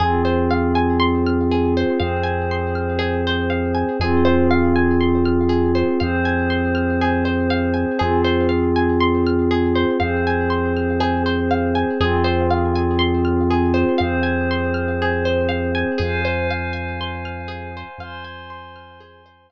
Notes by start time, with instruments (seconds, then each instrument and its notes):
0.00 synth bass 2 F2, pad 5 (bowed) C4 F4 G#4, orchestral harp G#4
0.25 orchestral harp C5
0.51 orchestral harp F5
0.75 orchestral harp G#5
1.00 orchestral harp C6
1.26 orchestral harp F6
1.51 orchestral harp G#4
1.77 orchestral harp C5
1.99 synth bass 2 F2, pad 5 (bowed) C4 G#4 C5, orchestral harp F5
2.24 orchestral harp G#5
2.51 orchestral harp C6
2.75 orchestral harp F6
2.99 orchestral harp G#4
3.27 orchestral harp C5
3.50 orchestral harp F5
3.75 orchestral harp G#5
4.00 synth bass 2 F2, pad 5 (bowed) C4 F4 G#4, orchestral harp G#4
4.25 orchestral harp C5
4.51 orchestral harp F5
4.76 orchestral harp G#5
5.01 orchestral harp C6
5.25 orchestral harp F6
5.49 orchestral harp G#4
5.75 orchestral harp C5
6.00 synth bass 2 F2, pad 5 (bowed) C4 G#4 C5, orchestral harp F5
6.25 orchestral harp G#5
6.50 orchestral harp C6
6.75 orchestral harp F6
7.01 orchestral harp G#4
7.25 orchestral harp C5
7.50 orchestral harp F5
7.74 orchestral harp G#5
7.98 synth bass 2 F2, pad 5 (bowed) C4 F4 G#4, orchestral harp G#4
8.24 orchestral harp C5
8.49 orchestral harp F5
8.76 orchestral harp G#5
9.00 orchestral harp C6
9.26 orchestral harp F6
9.51 orchestral harp G#4
9.75 orchestral harp C5
10.00 synth bass 2 F2, pad 5 (bowed) C4 G#4 C5, orchestral harp F5
10.27 orchestral harp G#5
10.50 orchestral harp C6
10.76 orchestral harp F6
11.00 orchestral harp G#4
11.26 orchestral harp C5
11.51 orchestral harp F5
11.75 orchestral harp G#5
12.00 synth bass 2 F2, pad 5 (bowed) C4 F4 G#4, orchestral harp G#4
12.24 orchestral harp C5
12.50 orchestral harp F5
12.75 orchestral harp G#5
12.99 orchestral harp C6
13.25 orchestral harp F6
13.50 orchestral harp G#4
13.74 orchestral harp C5
13.98 synth bass 2 F2, pad 5 (bowed) C4 G#4 C5, orchestral harp F5
14.23 orchestral harp G#5
14.51 orchestral harp C6
14.74 orchestral harp F6
15.02 orchestral harp G#4
15.25 orchestral harp C5
15.49 orchestral harp F5
15.75 orchestral harp G#5
15.98 synth bass 2 F2, orchestral harp G#4, pad 5 (bowed) C5 F5 G#5
16.25 orchestral harp C5
16.50 orchestral harp F5
16.73 orchestral harp G#5
17.01 orchestral harp C6
17.25 orchestral harp F6
17.48 orchestral harp G#4
17.77 orchestral harp C5
17.98 synth bass 2 F2, pad 5 (bowed) C5 G#5 C6, orchestral harp F5
18.25 orchestral harp G#5
18.50 orchestral harp C6
18.76 orchestral harp F6
19.00 orchestral harp G#4
19.26 orchestral harp C5
19.50 orchestral harp F5